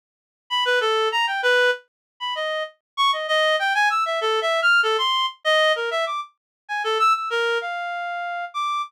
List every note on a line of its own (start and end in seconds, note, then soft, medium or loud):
0.50 0.64 B5 medium
0.65 0.79 B4 loud
0.81 1.09 A4 medium
1.12 1.26 A#5 medium
1.27 1.41 G5 medium
1.43 1.71 B4 loud
2.20 2.34 B5 medium
2.35 2.63 D#5 medium
2.97 3.11 C#6 loud
3.13 3.27 D#5 medium
3.28 3.56 D#5 loud
3.59 3.73 G5 medium
3.75 3.89 G#5 loud
3.90 4.04 E6 medium
4.06 4.20 E5 medium
4.21 4.40 A4 medium
4.42 4.60 E5 medium
4.62 4.81 F6 loud
4.83 4.97 A4 medium
4.98 5.26 C6 medium
5.45 5.72 D#5 loud
5.76 5.90 A#4 medium
5.91 6.05 E5 medium
6.06 6.20 D6 medium
6.69 6.82 G#5 medium
6.84 6.98 A4 medium
6.99 7.13 E6 loud
7.15 7.29 E6 medium
7.30 7.58 A#4 medium
7.61 8.45 F5 medium
8.54 8.82 D6 medium